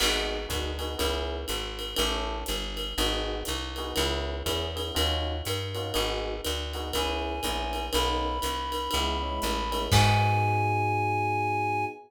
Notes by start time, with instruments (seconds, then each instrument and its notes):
0.00 electric bass (finger) G#1, electric piano 1 B3 D#4 F#4 G#4, crash, ride
0.49 electric bass (finger) D2, electric piano 1 B3 D#4 F#4 G#4, kick, hi-hat pedal, ride
0.79 electric piano 1 B3 D#4 F#4 G#4, ride
0.98 electric bass (finger) C#2, electric piano 1 B3 C#4 E4 G#4, kick, ride
1.48 electric bass (finger) G#1, hi-hat pedal, ride
1.79 ride
1.96 electric bass (finger) A1, electric piano 1 C#4 E4 G4 A4, ride
2.46 electric bass (finger) G1, hi-hat pedal, ride
2.77 ride
2.98 electric bass (finger) G#1, electric piano 1 B3 D#4 F#4 G#4, ride
3.45 electric bass (finger) C2, hi-hat pedal, ride
3.76 electric piano 1 B3 D#4 F#4 G#4, ride
3.96 electric bass (finger) C#2, electric piano 1 B3 C#4 E4 G#4, ride
4.46 electric bass (finger) E2, electric piano 1 B3 C#4 E4 G#4, kick, hi-hat pedal, ride
4.76 electric piano 1 B3 C#4 E4 G#4, ride
4.95 electric bass (finger) D#2, electric piano 1 C#4 D#4 F4 F#4, ride
5.45 electric bass (finger) G2, hi-hat pedal, ride
5.75 electric piano 1 C#4 D#4 F4 F#4, ride
5.94 electric bass (finger) G#1, electric piano 1 B3 D#4 F#4 G#4, ride
6.45 electric bass (finger) D2, hi-hat pedal, ride
6.73 electric piano 1 B3 D#4 F#4 G#4, ride
6.93 electric bass (finger) C#2, electric piano 1 B3 C#4 E4 G#4, clarinet G#5, kick, ride
7.43 electric bass (finger) A#1, electric piano 1 B3 C#4 E4 G#4, kick, hi-hat pedal, ride
7.73 ride
7.93 electric bass (finger) B1, electric piano 1 A#3 B3 C#4 D#4, clarinet B5, ride
8.42 electric bass (finger) C2, hi-hat pedal, ride
8.72 ride
8.91 electric bass (finger) C#2, electric piano 1 G#3 B3 C#4 E4, ride
9.22 electric piano 1 G#3 B3 C#4 E4
9.42 electric bass (finger) A1, hi-hat pedal, ride
9.71 electric piano 1 G#3 B3 C#4 E4, ride
9.92 electric bass (finger) G#2, electric piano 1 B3 D#4 F#4 G#4, clarinet G#5, kick, crash